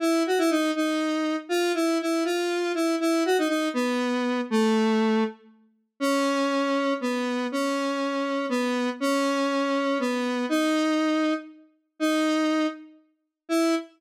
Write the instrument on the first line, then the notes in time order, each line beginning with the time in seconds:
lead 1 (square)
0.00 E4
0.27 F#4
0.38 E4
0.50 D#4
0.76 D#4
1.49 F4
1.74 E4
2.01 E4
2.25 F4
2.75 E4
3.00 E4
3.25 F#4
3.38 D#4
3.48 D#4
3.74 B3
4.50 A3
6.00 C#4
7.01 B3
7.52 C#4
8.49 B3
9.00 C#4
9.99 B3
10.49 D#4
11.99 D#4
13.49 E4